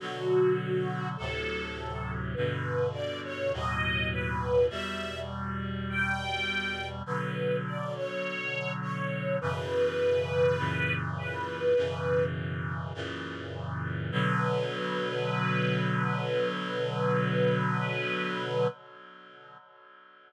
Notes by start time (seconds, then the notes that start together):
0.00 B2 D3 F#3 F#4
1.16 D2 A2 C3 F#3 A4
2.34 G2 B2 D3 B4
2.93 D5
3.24 C#5
3.52 D#2 A2 B2 F#3 D#5
4.11 B4
4.69 E2 B2 G3 E5
5.90 G5
7.06 B2 D3 F#3 B4
7.66 D5
7.95 C#5
8.82 C#5
9.41 F#2 B2 C#3 E3 B4
10.58 F#2 A#2 C#3 E3
11.18 B4
11.76 F#2 B2 C#3 E3
12.94 F#2 A#2 C#3 E3
14.11 B2 D3 F#3 B4